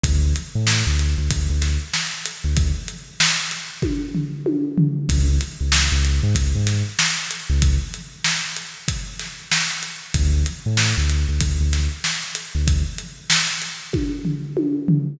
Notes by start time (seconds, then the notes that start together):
0.03 D2, kick, closed hi-hat
0.36 closed hi-hat
0.55 A2
0.67 snare
0.87 D2
0.99 closed hi-hat
1.18 D2
1.30 D2, kick, closed hi-hat
1.50 D2
1.62 snare, closed hi-hat
1.93 snare
2.26 closed hi-hat
2.44 D2
2.57 kick, closed hi-hat
2.88 closed hi-hat
3.20 snare
3.51 closed hi-hat
3.82 kick, high tom
4.14 floor tom
4.46 high tom
4.78 floor tom
5.09 C#2, kick, closed hi-hat
5.41 closed hi-hat
5.61 C#2
5.72 snare
5.92 C#2
6.05 closed hi-hat
6.23 G#2
6.35 C#2, kick, closed hi-hat
6.55 G#2
6.67 snare, closed hi-hat
6.99 snare
7.31 closed hi-hat
7.49 C#2
7.62 kick, closed hi-hat
7.94 closed hi-hat
8.24 snare
8.56 closed hi-hat
8.88 kick, closed hi-hat
9.19 snare, closed hi-hat
9.51 snare
9.83 closed hi-hat
10.14 D2, kick, closed hi-hat
10.46 closed hi-hat
10.66 A2
10.77 snare
10.97 D2
11.09 closed hi-hat
11.29 D2
11.41 D2, kick, closed hi-hat
11.60 D2
11.73 snare, closed hi-hat
12.04 snare
12.35 closed hi-hat
12.55 D2
12.67 kick, closed hi-hat
12.98 closed hi-hat
13.30 snare
13.62 closed hi-hat
13.93 kick, high tom
14.25 floor tom
14.57 high tom
14.88 floor tom